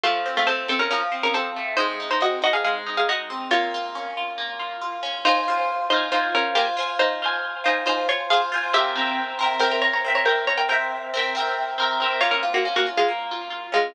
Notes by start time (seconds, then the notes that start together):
0.03 F3 A3 F4
0.26 C4
0.37 A3 F4
0.47 A3 C4 A4
0.68 C4 A4
0.79 C#4 A#4
0.91 F3 C#4 A#4
1.12 C4
1.23 C#4 A#4
1.34 C4 A4
1.56 A3
1.77 G#3 D#4 C5
2.00 D#4
2.11 D#4 C5
2.21 C4 F#4 D#5
2.42 D#4 F#4 D#5
2.53 G#4 F5
2.64 G#3 G#4 F5
2.86 D#4
2.97 G#4 F5
3.09 D#4 F#4 D#5
3.30 C4
3.51 A#3 F4 C#5
3.74 F4
3.95 C#4
4.17 F4
4.38 A#3
4.59 F4
4.81 F4
5.03 C#4
5.25 D#4 F4 C5 G#5
5.48 F4 C5 G#5
5.90 D#4 F4 C5
5.96 G#5
6.12 D#4 F4 C5 G#5
6.35 C#4 A#4
6.55 A#3 F4 G4 C5 G#5
6.77 F4 C5 G#5
6.99 D#4 C5
7.22 F4 C5 G#5
7.64 D#4 F4 C5 G#5
7.86 D#4 F4 C5 G#5
8.09 F4 C#5
8.30 F4 G#4 C5 F5
8.34 G#5
8.52 F4 C5 G#5
8.73 C4 G4 A#4 E5
8.79 G5
8.95 C4 A#4 E5
9.01 G5
9.39 C4 A#4 E5
9.44 G5
9.59 C4 A#4 E5 G5
9.65 G5
9.71 A#4 G5
9.82 C#5 A#5
9.93 C#5 A#5
10.04 C4 A#4 E5
10.10 G5
10.15 C#5 A#5
10.25 C4 A#4 E5 G5
10.30 G5
10.47 C#5 A#5
10.58 A#4 G5
10.69 C4 A#4 E5 G5
10.74 G5
11.14 C4 A#4 E5
11.19 G5
11.35 C4 A#4 E5
11.40 G5
11.78 C4 A#4 E5
11.83 G5
12.00 C4 A#4 E5
12.05 G5
12.21 A#3 F4 C#5
12.31 C#4 A#4
12.43 F4
12.54 A#3 F#4
12.65 C#4
12.76 A#3 F#4
12.86 F4
12.97 G#3 F4
13.08 A#3
13.31 F4
13.50 F4
13.72 G#3 C#4 F4